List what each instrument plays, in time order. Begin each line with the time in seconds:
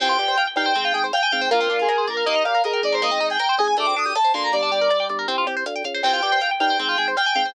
0.00 drawbar organ C2, overdriven guitar C4, lead 1 (square) G5, kick, cross-stick, crash
0.09 overdriven guitar F4
0.19 drawbar organ G2, overdriven guitar G4, closed hi-hat
0.28 overdriven guitar C5
0.38 overdriven guitar F5, closed hi-hat
0.47 overdriven guitar G5
0.56 drawbar organ G2, ocarina D#4, overdriven guitar F5, lead 1 (square) G5, kick, cross-stick, closed hi-hat
0.66 overdriven guitar C5
0.75 drawbar organ G#1, overdriven guitar C4, kick, closed hi-hat
0.85 overdriven guitar F4
0.94 drawbar organ G#1, overdriven guitar G#4, closed hi-hat
1.04 overdriven guitar C5
1.13 overdriven guitar F5, lead 1 (square) G5, cross-stick, closed hi-hat
1.23 overdriven guitar G#5
1.32 drawbar organ G#1, ocarina C4, overdriven guitar F5, kick, closed hi-hat
1.41 overdriven guitar C5
1.51 drawbar organ A#1, overdriven guitar A#3, lead 1 (square) F4, ocarina A#4, kick, closed hi-hat
1.60 overdriven guitar C4
1.70 drawbar organ A#1, overdriven guitar D4, closed hi-hat
1.79 overdriven guitar F4, lead 1 (square) G#4
1.89 overdriven guitar A#4, cross-stick, closed hi-hat
1.98 overdriven guitar C5
2.07 drawbar organ A#1, lead 1 (square) A#4, overdriven guitar D5, kick, closed hi-hat
2.17 overdriven guitar F5
2.26 drawbar organ D#2, overdriven guitar A#3, lead 1 (square) D#5, kick, closed hi-hat
2.35 overdriven guitar D#4
2.44 drawbar organ A#2, overdriven guitar G4, lead 1 (square) F5, cross-stick, closed hi-hat
2.55 overdriven guitar A#4
2.64 ocarina G#4, lead 1 (square) A#4, overdriven guitar D#5, closed hi-hat
2.73 overdriven guitar G5
2.83 drawbar organ G#1, lead 1 (square) D5, overdriven guitar D#5, kick, closed hi-hat
2.92 overdriven guitar A#4, lead 1 (square) C5
3.02 overdriven guitar A#3, lead 1 (square) D#5, kick, cross-stick, closed hi-hat
3.11 overdriven guitar C4
3.20 drawbar organ G#1, overdriven guitar D#4, closed hi-hat
3.30 overdriven guitar G#4, lead 1 (square) G5
3.39 overdriven guitar A#4, closed hi-hat
3.49 overdriven guitar C5
3.58 drawbar organ G#1, ocarina G#4, overdriven guitar D#5, lead 1 (square) G#5, kick, cross-stick, closed hi-hat
3.68 overdriven guitar G#5
3.77 drawbar organ D2, overdriven guitar A3, lead 1 (square) D6, kick, closed hi-hat
3.87 overdriven guitar C4
3.96 drawbar organ D2, overdriven guitar D4, lead 1 (square) D#6, closed hi-hat
4.06 overdriven guitar G4
4.15 overdriven guitar A4, lead 1 (square) A5, cross-stick, closed hi-hat
4.24 overdriven guitar C5
4.34 drawbar organ D2, overdriven guitar A#3, ocarina D4, lead 1 (square) C6, kick, closed hi-hat
4.43 lead 1 (square) A#5
4.52 drawbar organ G1, ocarina G3, lead 1 (square) D5, kick, closed hi-hat
4.62 overdriven guitar D4
4.72 drawbar organ G1, overdriven guitar G4, closed hi-hat
4.81 overdriven guitar A#4
4.90 overdriven guitar D5, cross-stick, closed hi-hat
5.00 overdriven guitar G5
5.09 drawbar organ G1, overdriven guitar D5, kick, closed hi-hat
5.19 overdriven guitar A#4
5.28 drawbar organ C2, ocarina C4, overdriven guitar C4, kick, closed hi-hat
5.38 overdriven guitar F4
5.47 drawbar organ C2, overdriven guitar G4, cross-stick, closed hi-hat
5.57 overdriven guitar C5
5.66 drawbar organ D2, overdriven guitar F5, closed hi-hat
5.76 overdriven guitar G5
5.84 drawbar organ C#2, overdriven guitar F5, kick, closed hi-hat
5.94 overdriven guitar C5
6.03 drawbar organ C2, overdriven guitar C4, lead 1 (square) G5, kick, cross-stick, crash
6.13 overdriven guitar F4
6.22 drawbar organ G2, overdriven guitar G4, closed hi-hat
6.32 overdriven guitar C5
6.41 overdriven guitar F5, closed hi-hat
6.51 overdriven guitar G5
6.60 drawbar organ G2, ocarina D#4, overdriven guitar F5, lead 1 (square) G5, kick, cross-stick, closed hi-hat
6.70 overdriven guitar C5
6.79 drawbar organ G#1, overdriven guitar C4, kick, closed hi-hat
6.89 overdriven guitar F4
6.98 drawbar organ G#1, overdriven guitar G#4, closed hi-hat
7.08 overdriven guitar C5
7.17 overdriven guitar F5, lead 1 (square) G5, cross-stick, closed hi-hat
7.26 overdriven guitar G#5
7.35 drawbar organ G#1, ocarina C4, overdriven guitar F5, kick, closed hi-hat
7.45 overdriven guitar C5